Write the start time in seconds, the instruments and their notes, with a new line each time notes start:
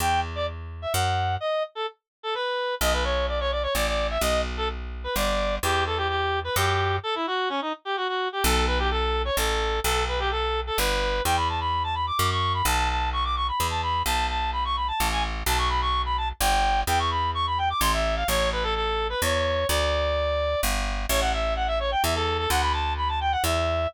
0.00 electric bass (finger) E2, clarinet G5
0.35 clarinet D5
0.82 clarinet E5
0.94 electric bass (finger) F#2, clarinet F#5
1.40 clarinet D#5
1.75 clarinet A4
2.23 clarinet A4
2.34 clarinet B4
2.81 electric bass (finger) B1, clarinet D#5
2.93 clarinet B4
3.04 clarinet C#5
3.28 clarinet D5
3.40 clarinet C#5
3.51 clarinet D5
3.63 clarinet C#5
3.75 electric bass (finger) A1, clarinet D5
3.87 clarinet D5
4.11 clarinet E5
4.21 electric bass (finger) B1, clarinet D#5
4.57 clarinet A4
5.04 clarinet B4
5.16 electric bass (finger) G1, clarinet D5
5.63 electric bass (finger) E2, clarinet G4
5.87 clarinet A4
5.97 clarinet G4
6.08 clarinet G4
6.44 clarinet B4
6.56 electric bass (finger) F#2, clarinet G4
7.03 clarinet A4
7.15 clarinet E4
7.27 clarinet F#4
7.49 clarinet C#4
7.61 clarinet D#4
7.85 clarinet G4
7.97 clarinet F#4
8.08 clarinet F#4
8.33 clarinet G4
8.43 electric bass (finger) B1, clarinet A4
8.67 clarinet B4
8.79 clarinet G4
8.91 clarinet A4
9.25 clarinet C#5
9.37 electric bass (finger) A1, clarinet A4
9.84 electric bass (finger) B1, clarinet A4
10.08 clarinet B4
10.19 clarinet G4
10.31 clarinet A4
10.67 clarinet A4
10.78 electric bass (finger) G1, clarinet B4
11.25 electric bass (finger) E2, clarinet G5
11.37 clarinet B5
11.49 clarinet A5
11.60 clarinet B5
11.84 clarinet A5
11.95 clarinet B5
12.07 clarinet D6
12.19 electric bass (finger) F#2
12.31 clarinet C#6
12.54 clarinet B5
12.65 electric bass (finger) B1, clarinet A5
12.89 clarinet A5
13.13 clarinet C#6
13.24 clarinet D6
13.36 clarinet C#6
13.48 clarinet B5
13.60 electric bass (finger) E2
13.70 clarinet A5
13.83 clarinet B5
14.06 electric bass (finger) B1, clarinet A5
14.29 clarinet A5
14.53 clarinet B5
14.65 clarinet C#6
14.76 clarinet B5
14.88 clarinet A5
15.00 electric bass (finger) A1
15.12 clarinet G#5
15.46 electric bass (finger) B1, clarinet A5
15.58 clarinet C#6
15.69 clarinet B5
15.81 clarinet C#6
16.06 clarinet B5
16.17 clarinet A5
16.41 electric bass (finger) G1, clarinet G5
16.87 electric bass (finger) E2, clarinet G5
16.99 clarinet C#6
17.11 clarinet B5
17.35 clarinet C#6
17.47 clarinet B5
17.58 clarinet G5
17.70 clarinet D6
17.81 electric bass (finger) A1, clarinet C6
17.93 clarinet E5
18.16 clarinet F5
18.28 electric bass (finger) A1, clarinet C#5
18.52 clarinet B4
18.63 clarinet A4
18.75 clarinet A4
19.10 clarinet B4
19.22 electric bass (finger) E2, clarinet C#5
19.69 electric bass (finger) D2, clarinet D5
20.63 electric bass (finger) G1
21.09 electric bass (finger) A1, clarinet C#5
21.21 clarinet F#5
21.33 clarinet E5
21.56 clarinet F#5
21.67 clarinet E5
21.80 clarinet C#5
21.91 clarinet G5
22.03 electric bass (finger) E2, clarinet E5
22.15 clarinet A4
22.38 clarinet A4
22.50 electric bass (finger) D2, clarinet F#5
22.61 clarinet B5
22.73 clarinet A5
22.97 clarinet B5
23.08 clarinet A5
23.21 clarinet G5
23.32 clarinet F#5
23.44 electric bass (finger) E2, clarinet E5